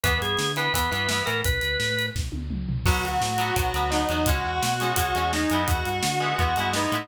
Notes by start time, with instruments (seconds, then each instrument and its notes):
0.04 synth bass 1 E2, overdriven guitar E3 B3, drawbar organ B4, kick, closed hi-hat
0.21 synth bass 1 G2, drawbar organ G#4, closed hi-hat
0.37 synth bass 1 D3, snare, closed hi-hat
0.56 overdriven guitar E3 B3, drawbar organ B4, closed hi-hat
0.74 synth bass 1 E2, overdriven guitar E3 B3, drawbar organ B4, kick, closed hi-hat
0.91 synth bass 1 G2, overdriven guitar E3 B3, closed hi-hat
1.09 overdriven guitar E3 B3, snare
1.26 synth bass 1 A2, overdriven guitar E3 B3, drawbar organ A#4, closed hi-hat
1.44 synth bass 1 B1, drawbar organ B4, kick, closed hi-hat
1.61 synth bass 1 D2, closed hi-hat
1.80 synth bass 1 A2, snare
1.99 closed hi-hat
2.15 synth bass 1 B1, kick, snare
2.32 synth bass 1 D2, high tom
2.51 synth bass 1 C#2, mid tom
2.68 synth bass 1 C2, floor tom
2.86 synth bass 1 B1, overdriven guitar F#3 B3, distortion guitar F#4 F#5, kick, crash
3.04 synth bass 1 D2, distortion guitar F#4 F#5, closed hi-hat
3.21 synth bass 1 A2, snare
3.38 overdriven guitar F#3 B3, closed hi-hat
3.56 synth bass 1 B1, overdriven guitar F#3 B3, distortion guitar F#4 F#5, kick, closed hi-hat
3.74 synth bass 1 D2, overdriven guitar F#3 B3, closed hi-hat
3.90 overdriven guitar F#3 B3, distortion guitar D#4 D#5, snare
4.09 synth bass 1 E2, overdriven guitar F#3 B3, closed hi-hat
4.26 synth bass 1 C#2, overdriven guitar G#3 C#4, distortion guitar F#4 F#5, kick, closed hi-hat
4.44 synth bass 1 E2, distortion guitar F#4 F#5
4.62 synth bass 1 B2, snare, closed hi-hat
4.80 overdriven guitar G#3 C#4, closed hi-hat
4.96 synth bass 1 C#2, overdriven guitar G#3 C#4, distortion guitar F#4 F#5, kick, closed hi-hat
5.15 synth bass 1 E2, overdriven guitar G#3 C#4, closed hi-hat
5.33 overdriven guitar G#3 C#4, distortion guitar D#4 D#5, snare
5.50 synth bass 1 F#2, overdriven guitar G#3 B3, closed hi-hat
5.55 overdriven guitar E4
5.67 synth bass 1 E2, distortion guitar F#4 F#5, kick, closed hi-hat
5.85 synth bass 1 G2, distortion guitar F#4 F#5, closed hi-hat
6.03 synth bass 1 D3, snare
6.20 overdriven guitar G#3 B3 E4
6.38 synth bass 1 E2, overdriven guitar G#3 B3 E4, distortion guitar F#4 F#5, kick, closed hi-hat
6.56 synth bass 1 G2, overdriven guitar G#3 B3, closed hi-hat
6.60 overdriven guitar E4
6.73 overdriven guitar G#3 B3, distortion guitar D#4 D#5, snare
6.78 overdriven guitar E4
6.92 synth bass 1 A2, overdriven guitar G#3 B3 E4, closed hi-hat